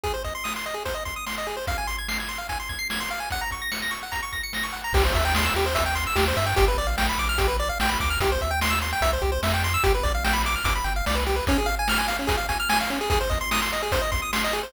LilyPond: <<
  \new Staff \with { instrumentName = "Lead 1 (square)" } { \time 4/4 \key des \major \tempo 4 = 147 aes'16 c''16 ees''16 c'''16 ees'''16 c'''16 ees''16 aes'16 c''16 ees''16 c'''16 ees'''16 c'''16 ees''16 aes'16 c''16 | f''16 aes''16 c'''16 aes'''16 c''''16 aes'''16 c'''16 f''16 aes''16 c'''16 aes'''16 c''''16 aes'''16 c'''16 f''16 aes''16 | ges''16 bes''16 des'''16 bes'''16 des''''16 bes'''16 des'''16 ges''16 bes''16 des'''16 bes'''16 des''''16 bes'''16 des'''16 ges''16 bes''16 | \key c \major g'16 c''16 e''16 g''16 c'''16 e'''16 g'16 c''16 e''16 g''16 c'''16 e'''16 g'16 c''16 e''16 g''16 |
g'16 b'16 d''16 f''16 g''16 b''16 d'''16 f'''16 g'16 b'16 d''16 f''16 g''16 b''16 d'''16 f'''16 | g'16 c''16 e''16 g''16 c'''16 e'''16 c'''16 g''16 e''16 c''16 g'16 c''16 e''16 g''16 c'''16 e'''16 | g'16 b'16 d''16 f''16 g''16 b''16 d'''16 f'''16 d'''16 b''16 g''16 f''16 d''16 b'16 g'16 b'16 | \key des \major des'16 aes'16 f''16 aes''16 f'''16 aes''16 f''16 des'16 aes'16 f''16 aes''16 f'''16 aes''16 f''16 des'16 aes'16 |
aes'16 c''16 ees''16 c'''16 ees'''16 c'''16 ees''16 aes'16 c''16 ees''16 c'''16 ees'''16 c'''16 ees''16 aes'16 c''16 | }
  \new Staff \with { instrumentName = "Synth Bass 1" } { \clef bass \time 4/4 \key des \major r1 | r1 | r1 | \key c \major c,8 dis,4 dis,4. dis,8 g,8 |
g,,8 ais,,4 ais,,4. ais,,8 d,8 | c,8 dis,4. c,8 c,8 f,4 | g,,8 ais,,4. g,,8 g,,8 c,4 | \key des \major r1 |
r1 | }
  \new DrumStaff \with { instrumentName = "Drums" } \drummode { \time 4/4 <hh bd>8 <hh bd>8 sn8 hh8 <hh bd>8 <hh bd>8 sn8 hh8 | <hh bd>8 hh8 sn8 hh8 <hh bd>8 <hh bd>8 sn8 hh8 | <hh bd>8 <hh bd>8 sn8 hh8 <hh bd>8 <hh bd>8 sn8 hh8 | <cymc bd>8 <hh bd>8 sn8 hh8 <hh bd>8 hh8 sn8 hho8 |
<hh bd>8 hh8 sn8 hh8 <hh bd>8 hh8 sn8 <hh bd>8 | <hh bd>8 <hh bd>8 sn8 hh8 <hh bd>8 <hh bd>8 sn8 hh8 | <hh bd>8 <hh bd>8 sn8 hh8 <hh bd>8 hh8 sn8 hh8 | <hh bd>8 hh8 sn8 hh8 <hh bd>8 <hh bd>8 sn8 hh8 |
<hh bd>8 <hh bd>8 sn8 hh8 <hh bd>8 <hh bd>8 sn8 hh8 | }
>>